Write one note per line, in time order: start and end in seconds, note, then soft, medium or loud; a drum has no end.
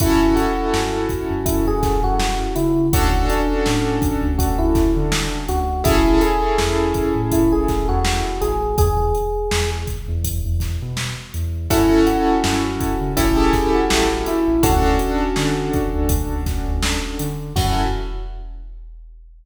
0.00 0.34 F#2 medium
0.00 2.65 C#4 loud
0.00 2.65 E4 loud
0.00 0.34 E4 loud
0.00 2.65 F#4 loud
0.00 2.65 A4 loud
0.00 kick loud
0.00 closed hi-hat loud
0.36 1.41 F#4 loud
0.36 closed hi-hat medium
0.73 1.07 F#2 medium
0.73 snare loud
1.09 kick medium
1.09 closed hi-hat medium
1.30 1.63 F#2 medium
1.46 1.65 E4 medium
1.46 kick loud
1.46 closed hi-hat loud
1.67 2.00 F#2 medium
1.67 2.00 G#4 loud
1.83 kick loud
1.83 snare medium
1.83 closed hi-hat medium
2.04 2.36 F#2 medium
2.04 2.53 F#4 loud
2.20 snare loud
2.55 2.89 C#3 medium
2.55 2.86 E4 medium
2.55 closed hi-hat medium
2.93 3.26 D2 medium
2.93 5.58 C#4 loud
2.93 5.58 D4 loud
2.93 3.26 F#4 loud
2.93 5.58 F#4 loud
2.93 5.58 A4 loud
2.93 kick loud
2.93 closed hi-hat loud
3.30 4.29 D4 medium
3.30 closed hi-hat medium
3.66 3.99 A2 medium
3.66 snare loud
4.02 kick loud
4.02 closed hi-hat medium
4.23 4.55 D2 medium
4.38 4.58 F#4 loud
4.38 kick loud
4.38 closed hi-hat loud
4.59 4.92 D2 medium
4.59 4.91 E4 medium
4.75 kick loud
4.75 snare medium
4.75 closed hi-hat medium
4.96 5.29 D3 medium
5.12 snare loud
5.48 5.82 D2 medium
5.48 5.82 F#4 loud
5.48 closed hi-hat medium
5.84 6.19 A1 medium
5.84 8.48 C#4 loud
5.84 8.48 E4 loud
5.84 6.21 E4 loud
5.84 8.48 G#4 loud
5.84 8.48 A4 loud
5.84 kick loud
5.84 closed hi-hat loud
6.21 7.21 G#4 loud
6.21 closed hi-hat medium
6.58 6.92 E2 medium
6.58 snare loud
6.94 kick medium
6.94 closed hi-hat medium
7.16 7.48 A2 medium
7.32 7.52 E4 loud
7.32 kick medium
7.32 closed hi-hat loud
7.52 7.84 A1 medium
7.52 7.86 G#4 medium
7.68 kick medium
7.68 snare medium
7.68 closed hi-hat medium
7.89 8.22 E2 medium
7.89 8.38 F#4 loud
8.05 snare loud
8.41 8.75 A1 medium
8.41 8.76 G#4 loud
8.41 closed hi-hat medium
8.78 9.12 E2 medium
8.78 9.70 G#4 loud
8.78 kick loud
8.78 closed hi-hat loud
9.15 closed hi-hat medium
9.51 9.85 E2 medium
9.51 snare loud
9.87 kick medium
9.87 closed hi-hat medium
10.08 10.41 E2 medium
10.25 kick medium
10.25 closed hi-hat loud
10.45 10.78 E2 medium
10.60 kick medium
10.60 snare medium
10.60 closed hi-hat medium
10.82 11.14 B2 medium
10.97 snare loud
11.34 11.68 E2 medium
11.34 closed hi-hat medium
11.70 12.04 F#2 medium
11.70 13.04 C#4 loud
11.70 13.04 E4 loud
11.70 12.02 E4 loud
11.70 13.04 F#4 loud
11.70 13.04 A4 loud
11.70 kick loud
11.70 closed hi-hat loud
12.07 13.13 F#4 loud
12.07 closed hi-hat medium
12.44 12.78 F#2 medium
12.44 snare loud
12.80 kick medium
12.80 closed hi-hat medium
13.01 13.15 C#3 medium
13.16 13.51 A1 medium
13.16 14.50 C#4 loud
13.16 13.36 E4 medium
13.16 14.50 E4 loud
13.16 14.50 G4 loud
13.16 14.50 A4 loud
13.16 kick loud
13.16 closed hi-hat loud
13.37 13.70 G#4 medium
13.53 kick medium
13.53 snare medium
13.53 closed hi-hat medium
13.75 14.25 F#4 medium
13.90 14.24 A1 medium
13.90 snare loud
14.26 14.62 E4 loud
14.26 closed hi-hat medium
14.48 14.62 A1 medium
14.63 14.97 D2 medium
14.63 17.27 C#4 loud
14.63 17.27 D4 loud
14.63 17.27 F#4 loud
14.63 15.72 F#4 loud
14.63 17.27 A4 loud
14.63 kick loud
14.63 closed hi-hat loud
14.99 closed hi-hat medium
15.36 15.70 D3 medium
15.36 snare loud
15.73 kick loud
15.73 closed hi-hat medium
15.94 16.27 D2 medium
16.09 kick loud
16.09 closed hi-hat loud
16.30 16.63 D2 medium
16.46 kick medium
16.46 snare medium
16.46 closed hi-hat medium
16.67 17.00 D2 medium
16.82 snare loud
17.19 17.53 D3 medium
17.19 closed hi-hat loud
17.56 17.83 F#2 loud
17.56 17.84 C#4 loud
17.56 17.84 E4 medium
17.56 17.83 F#4 loud
17.56 17.84 F#4 loud
17.56 17.84 A4 loud
17.56 kick loud
17.56 crash loud